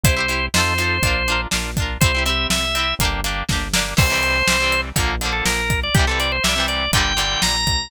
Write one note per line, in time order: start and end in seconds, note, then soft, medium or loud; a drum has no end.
0.04 0.49 C2 loud
0.04 0.15 E4 loud
0.04 0.15 G4 loud
0.04 0.46 C5 medium
0.04 kick loud
0.04 closed hi-hat loud
0.09 0.15 C5 loud
0.17 0.26 E4 medium
0.17 0.26 G4 medium
0.17 0.26 C5 medium
0.28 0.48 E4 medium
0.28 0.48 G4 medium
0.28 0.48 C5 medium
0.28 closed hi-hat medium
0.54 1.00 F2 loud
0.54 0.74 D#4 medium
0.54 0.74 F4 loud
0.54 0.74 A4 loud
0.54 1.41 C5 medium
0.54 snare loud
0.60 0.74 C5 loud
0.78 0.98 D#4 medium
0.78 0.98 F4 medium
0.78 0.98 A4 medium
0.78 closed hi-hat medium
0.84 0.98 C5 medium
1.03 1.47 A#1 loud
1.03 1.23 D4 medium
1.03 1.23 F4 loud
1.03 kick loud
1.03 closed hi-hat loud
1.07 1.23 A#4 loud
1.28 1.48 D4 medium
1.28 1.48 F4 medium
1.28 1.48 A#4 medium
1.28 closed hi-hat medium
1.51 1.98 A#1 medium
1.51 1.71 D4 medium
1.51 1.71 F4 medium
1.51 1.71 A#4 medium
1.51 snare loud
1.77 1.98 D4 medium
1.77 1.98 F4 medium
1.77 kick loud
1.77 closed hi-hat medium
1.82 1.98 A#4 medium
2.01 2.47 C2 loud
2.01 2.12 C4 loud
2.01 2.12 E4 loud
2.01 2.23 C5 medium
2.01 kick loud
2.01 closed hi-hat loud
2.06 2.12 G4 loud
2.15 2.24 C4 medium
2.15 2.24 E4 medium
2.15 2.24 G4 medium
2.26 2.65 C4 medium
2.26 2.65 E4 medium
2.26 2.65 G4 medium
2.26 2.47 E5 medium
2.26 closed hi-hat medium
2.50 2.94 C2 medium
2.50 2.94 E5 medium
2.50 snare loud
2.75 2.95 C4 medium
2.75 2.95 E4 medium
2.75 2.95 G4 medium
2.75 closed hi-hat medium
2.99 3.43 G1 loud
2.99 3.21 A#3 loud
2.99 3.21 D4 loud
2.99 kick loud
2.99 closed hi-hat loud
3.05 3.21 G4 loud
3.24 3.44 A#3 medium
3.24 3.44 D4 loud
3.24 3.44 G4 loud
3.24 closed hi-hat medium
3.49 3.94 G1 medium
3.49 3.68 A#3 medium
3.49 3.68 D4 medium
3.49 3.68 G4 loud
3.49 kick loud
3.49 snare loud
3.74 3.94 A#3 loud
3.74 3.94 D4 medium
3.74 snare loud
3.78 3.94 G4 medium
3.97 4.43 C2 loud
3.97 4.07 E3 loud
3.97 4.07 G3 loud
3.97 4.07 C4 loud
3.97 4.81 C5 medium
3.97 kick loud
3.97 crash loud
4.10 4.40 E3 loud
4.10 4.40 G3 medium
4.10 4.40 C4 medium
4.23 closed hi-hat medium
4.48 4.92 C2 medium
4.48 4.58 E3 medium
4.48 4.58 G3 medium
4.48 snare loud
4.52 4.58 C4 medium
4.60 4.89 E3 medium
4.60 4.89 G3 medium
4.60 4.89 C4 medium
4.72 closed hi-hat medium
4.96 5.42 A#1 loud
4.96 5.15 D3 loud
4.96 5.15 F3 loud
4.96 5.15 A#3 loud
4.96 kick loud
4.96 closed hi-hat loud
5.21 5.61 D3 medium
5.21 5.61 F3 medium
5.21 closed hi-hat medium
5.25 5.61 A#3 medium
5.32 5.44 A4 medium
5.46 5.90 A#1 medium
5.46 5.80 A#4 medium
5.46 snare loud
5.70 kick loud
5.70 closed hi-hat medium
5.83 5.95 D5 medium
5.95 6.40 C2 loud
5.95 6.05 C3 medium
5.95 6.05 E3 loud
5.95 6.06 G4 medium
5.95 kick loud
5.95 closed hi-hat loud
5.99 6.05 G3 loud
6.07 6.37 C3 medium
6.07 6.37 E3 medium
6.07 6.37 G3 medium
6.07 6.19 A4 medium
6.20 6.32 D5 medium
6.20 closed hi-hat medium
6.32 6.44 C5 medium
6.44 6.89 C2 medium
6.44 6.54 C3 medium
6.44 6.54 E3 medium
6.44 6.66 E5 medium
6.44 snare loud
6.48 6.54 G3 loud
6.56 6.86 C3 medium
6.56 6.86 E3 medium
6.56 6.86 G3 medium
6.68 6.91 D5 medium
6.68 closed hi-hat medium
6.92 7.36 G1 medium
6.92 7.13 A#2 loud
6.92 7.13 D3 loud
6.92 7.42 G5 medium
6.92 kick loud
6.92 closed hi-hat loud
6.97 7.13 G3 loud
7.17 7.56 A#2 medium
7.17 7.56 D3 medium
7.17 7.56 G3 medium
7.17 closed hi-hat medium
7.42 7.65 A#1 medium
7.42 7.90 A#5 medium
7.42 snare loud
7.66 7.88 B1 medium
7.66 kick loud
7.66 closed hi-hat medium